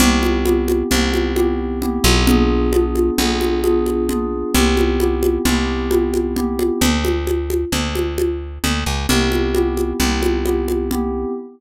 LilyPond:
<<
  \new Staff \with { instrumentName = "Electric Piano 2" } { \time 5/4 \key c \major \tempo 4 = 132 <b c' e' g'>4 <b c' e' g'>4 <b c' e' g'>4 <b c' e' g'>4 <b c' e' g'>4 | <b d' f' aes'>4 <b d' f' aes'>4 <b d' f' aes'>4 <b d' f' aes'>4 <b d' f' aes'>4 | <b c' e' g'>4 <b c' e' g'>4 <b c' e' g'>4 <b c' e' g'>4 <b c' e' g'>4 | r1 r4 |
<b c' e' g'>4 <b c' e' g'>4 <b c' e' g'>4 <b c' e' g'>4 <b c' e' g'>4 | }
  \new Staff \with { instrumentName = "Electric Bass (finger)" } { \clef bass \time 5/4 \key c \major c,2 c,2~ c,8 b,,8~ | b,,2 b,,2. | c,2 c,2. | d,2 d,2 d,8 cis,8 |
c,2 c,2. | }
  \new DrumStaff \with { instrumentName = "Drums" } \drummode { \time 5/4 cgl8 cgho8 cgho8 cgho8 cgl8 cgho8 cgho4 cgl8 cgho8 | cgl4 cgho8 cgho8 cgl8 cgho8 cgho8 cgho8 cgl4 | cgl8 cgho8 cgho8 cgho8 cgl4 cgho8 cgho8 cgl8 cgho8 | cgl8 cgho8 cgho8 cgho8 cgl8 cgho8 cgho4 cgl4 |
cgl8 cgho8 cgho8 cgho8 cgl8 cgho8 cgho8 cgho8 cgl4 | }
>>